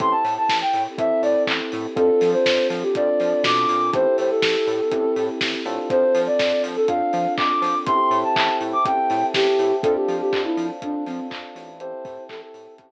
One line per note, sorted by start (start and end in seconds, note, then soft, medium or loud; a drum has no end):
0.00 0.14 A1 loud
0.00 0.88 C4 medium
0.00 1.94 C4 medium
0.00 0.88 E4 medium
0.00 1.94 E4 medium
0.00 0.88 G4 medium
0.00 1.94 G4 loud
0.00 0.88 A4 medium
0.00 1.94 A4 medium
0.00 0.12 C6 medium
0.00 kick medium
0.00 closed hi-hat medium
0.11 0.34 A5 medium
0.24 0.38 A2 medium
0.24 open hi-hat medium
0.37 0.57 A5 medium
0.49 0.63 A1 medium
0.49 kick medium
0.49 snare medium
0.61 0.83 G5 medium
0.73 0.87 A2 medium
0.73 open hi-hat medium
0.98 1.11 A1 medium
0.98 1.87 C4 medium
0.98 1.87 E4 medium
0.98 1.87 G4 medium
0.98 1.87 A4 medium
0.98 1.22 E5 medium
0.98 kick medium
0.98 closed hi-hat medium
1.22 1.36 A2 medium
1.22 1.43 D5 medium
1.22 open hi-hat medium
1.47 1.61 A1 medium
1.47 kick medium
1.47 clap loud
1.72 1.87 A2 loud
1.72 open hi-hat medium
1.96 2.10 F2 loud
1.96 2.85 C4 medium
1.96 3.91 C4 medium
1.96 2.85 D4 medium
1.96 3.91 D4 medium
1.96 2.85 F4 medium
1.96 3.91 F4 loud
1.96 2.85 A4 medium
1.96 3.91 A4 medium
1.96 2.30 A4 medium
1.96 kick medium
1.96 closed hi-hat medium
2.21 2.35 F3 medium
2.21 open hi-hat medium
2.32 2.67 C5 medium
2.46 2.59 F2 medium
2.46 kick medium
2.46 snare medium
2.70 2.84 F3 medium
2.70 open hi-hat medium
2.83 2.94 G4 medium
2.95 3.10 F2 medium
2.95 3.85 C4 medium
2.95 3.85 D4 medium
2.95 3.85 F4 medium
2.95 3.85 A4 medium
2.95 3.43 D5 medium
2.95 kick medium
2.95 closed hi-hat medium
3.20 3.34 F3 medium
3.20 open hi-hat medium
3.44 3.66 B2 loud
3.44 3.91 D6 medium
3.44 kick medium
3.44 snare loud
3.69 3.91 A#2 medium
3.69 open hi-hat medium
3.93 4.06 A1 loud
3.93 4.82 C4 medium
3.93 5.88 C4 medium
3.93 4.82 E4 medium
3.93 5.88 E4 medium
3.93 4.82 G4 medium
3.93 5.88 G4 medium
3.93 4.82 A4 medium
3.93 5.88 A4 medium
3.93 4.16 C5 loud
3.93 kick medium
3.93 closed hi-hat medium
4.18 4.32 A2 medium
4.18 4.30 C5 medium
4.18 open hi-hat medium
4.30 5.25 A4 medium
4.42 4.56 A1 medium
4.42 kick medium
4.42 snare loud
4.67 4.81 A2 medium
4.67 open hi-hat medium
4.91 5.06 A1 medium
4.91 5.61 C4 medium
4.91 5.61 E4 medium
4.91 5.61 G4 medium
4.91 5.61 A4 medium
4.91 kick medium
4.91 closed hi-hat medium
5.16 5.30 A2 medium
5.16 open hi-hat medium
5.41 5.55 A1 medium
5.41 kick medium
5.41 snare medium
5.65 5.79 A2 medium
5.65 6.79 C4 medium
5.65 6.79 D4 medium
5.65 6.79 F4 medium
5.65 6.79 A4 medium
5.65 open hi-hat medium
5.90 6.04 F2 medium
5.90 7.85 C4 medium
5.90 7.85 D4 medium
5.90 7.85 F4 medium
5.90 7.85 A4 medium
5.90 6.21 C5 loud
5.90 kick medium
5.90 closed hi-hat medium
6.15 6.28 F3 loud
6.15 open hi-hat medium
6.26 6.62 D5 medium
6.39 6.53 F2 medium
6.39 kick medium
6.39 snare medium
6.63 6.77 F3 medium
6.63 open hi-hat medium
6.76 6.88 A4 medium
6.88 7.02 F2 medium
6.88 7.77 C4 medium
6.88 7.77 D4 medium
6.88 7.77 F4 medium
6.88 7.77 A4 medium
6.88 7.34 F5 medium
6.88 kick medium
6.88 closed hi-hat medium
7.13 7.27 F3 medium
7.13 open hi-hat medium
7.37 7.51 F2 medium
7.37 7.78 D6 medium
7.37 kick medium
7.37 clap medium
7.62 7.75 F3 loud
7.62 open hi-hat medium
7.86 8.00 A1 loud
7.86 8.77 C4 medium
7.86 8.77 E4 medium
7.86 8.77 G4 medium
7.86 8.77 A4 medium
7.86 9.82 C5 medium
7.86 9.82 E5 loud
7.86 9.82 G5 loud
7.86 9.82 A5 medium
7.86 8.18 C6 loud
7.86 kick medium
7.86 closed hi-hat medium
8.11 8.24 A2 loud
8.11 open hi-hat medium
8.23 8.57 A5 medium
8.36 8.49 A1 loud
8.36 kick medium
8.36 clap loud
8.61 8.74 A2 medium
8.61 open hi-hat medium
8.73 8.85 D6 medium
8.85 8.99 A1 medium
8.85 9.73 C4 medium
8.85 9.73 E4 medium
8.85 9.73 G4 medium
8.85 9.73 A4 medium
8.85 9.26 G5 medium
8.85 kick medium
8.85 closed hi-hat medium
9.10 9.24 A2 medium
9.10 open hi-hat medium
9.34 9.47 A1 medium
9.34 9.75 G4 medium
9.34 kick medium
9.34 snare medium
9.59 9.73 A2 medium
9.59 open hi-hat medium
9.82 9.97 F2 loud
9.82 10.73 C4 medium
9.82 10.73 D4 medium
9.82 10.73 F4 medium
9.82 9.94 A4 loud
9.82 10.73 A4 medium
9.82 11.78 C5 medium
9.82 11.78 D5 medium
9.82 11.78 F5 medium
9.82 11.78 A5 medium
9.82 kick loud
9.82 closed hi-hat medium
9.95 10.16 G4 medium
10.08 10.22 F3 medium
10.08 open hi-hat medium
10.21 10.41 G4 medium
10.33 10.47 F2 medium
10.33 kick medium
10.33 clap medium
10.45 10.67 E4 medium
10.57 10.71 F3 medium
10.57 open hi-hat medium
10.82 10.96 F2 medium
10.82 11.71 C4 medium
10.82 11.71 D4 medium
10.82 11.04 D4 medium
10.82 11.71 F4 medium
10.82 11.71 A4 medium
10.82 kick medium
10.82 closed hi-hat medium
11.06 11.20 F3 medium
11.06 11.27 C4 medium
11.06 open hi-hat medium
11.30 11.44 F2 medium
11.30 kick medium
11.30 clap medium
11.55 11.93 A1 medium
11.55 open hi-hat medium
11.79 12.91 C4 medium
11.79 12.91 E4 medium
11.79 12.91 G4 medium
11.79 12.91 A4 medium
11.79 12.91 C5 medium
11.79 12.24 C5 medium
11.79 12.91 E5 medium
11.79 12.91 G5 medium
11.79 12.91 A5 loud
11.79 closed hi-hat medium
12.05 12.18 A2 medium
12.05 kick loud
12.05 open hi-hat medium
12.29 12.42 A1 loud
12.29 12.41 A4 medium
12.29 kick medium
12.29 clap medium
12.41 12.74 A4 medium
12.54 12.68 A2 medium
12.54 open hi-hat medium
12.78 12.91 A1 medium
12.78 kick medium
12.78 closed hi-hat medium